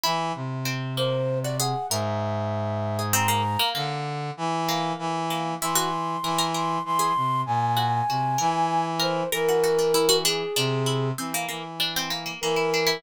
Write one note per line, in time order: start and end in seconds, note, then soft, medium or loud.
0.03 0.32 E3 loud
0.03 0.59 E4 loud
0.35 1.74 C3 medium
0.65 0.93 C4 medium
0.97 1.39 A#3 medium
0.97 1.38 C5 medium
1.43 1.58 F#4 soft
1.43 1.57 D5 loud
1.59 1.87 G#4 medium
1.59 1.86 F#5 medium
1.90 3.57 G#2 medium
1.90 2.33 A#4 medium
1.90 3.01 E5 medium
2.99 3.13 G#4 soft
3.13 3.27 C4 loud
3.13 3.69 A#5 loud
3.28 3.42 A#3 medium
3.59 3.73 A#3 medium
3.75 4.31 D3 loud
3.75 4.58 A#3 medium
4.37 4.93 E3 loud
4.69 5.24 A#3 medium
4.99 5.54 E3 loud
5.30 5.58 A#3 medium
5.61 6.16 E3 medium
5.61 5.76 E4 medium
5.61 6.45 C6 medium
5.75 5.89 F#4 loud
6.23 6.78 E3 loud
6.23 6.38 A#4 medium
6.39 6.52 A#4 medium
6.54 6.82 A#4 medium
6.54 6.82 C6 medium
6.85 7.13 E3 medium
6.85 7.41 C6 loud
6.99 7.13 G#4 medium
7.16 7.43 C3 medium
7.46 8.02 A#2 medium
7.46 8.85 G#5 medium
7.77 8.05 F#4 medium
8.09 8.36 C3 medium
8.09 8.38 F#4 soft
8.38 9.23 E3 loud
8.38 8.94 A#4 medium
8.99 9.27 A#4 medium
8.99 9.29 C5 medium
9.32 10.43 E3 medium
9.32 9.46 A#4 loud
9.32 10.16 A#4 loud
9.49 9.63 F#4 medium
9.64 9.77 F#4 medium
9.79 9.93 D4 medium
9.94 10.08 E4 medium
10.09 10.23 F#4 loud
10.24 10.53 D4 loud
10.24 11.08 G#4 medium
10.56 11.11 C3 medium
10.56 10.84 D4 medium
10.86 11.14 E4 medium
11.18 11.45 E3 medium
11.18 11.32 C4 medium
11.34 11.48 A#3 medium
11.48 12.32 E3 medium
11.48 11.63 A#3 medium
11.80 11.94 D4 medium
11.96 12.10 C4 medium
12.10 12.24 A#3 medium
12.26 12.40 A#3 medium
12.41 12.97 E3 medium
12.41 12.57 A#3 medium
12.41 12.97 A#4 medium
12.56 12.70 E4 medium
12.74 12.88 D4 medium
12.87 13.01 E4 loud